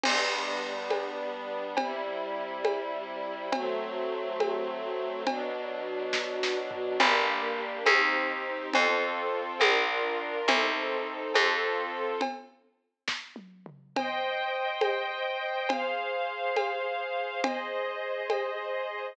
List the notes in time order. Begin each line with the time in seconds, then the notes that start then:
0.04 G3 B3 D4, crash, cowbell, low conga
0.90 cowbell, high conga
1.77 C3 G3 E4, cowbell, low conga
2.65 cowbell, high conga
3.52 F#3 A3 C4, cowbell, low conga
4.40 cowbell, high conga
5.26 B2 F#3 D4, cowbell, low conga
6.13 kick, snare
6.43 snare
6.71 floor tom
7.00 G1 A#3 D4 G4, cowbell, low conga
7.86 D#2 C4 D#4 G4, cowbell, high conga
8.73 F2 C4 F4 A4, cowbell, low conga
9.60 A#1 D4 F4 A#4, cowbell, high conga
10.48 C2 C4 D#4 A4, cowbell, low conga
11.34 F2 C4 F4 A4, cowbell, high conga
12.21 cowbell, low conga
13.08 kick, snare
13.36 high tom
13.66 mid tom
13.96 C5 D#5 G5, cowbell, low conga
14.81 cowbell, high conga
15.69 G#4 C5 F5, cowbell, low conga
16.56 cowbell, high conga
17.43 G#4 C5 D#5, cowbell, low conga
18.30 cowbell, high conga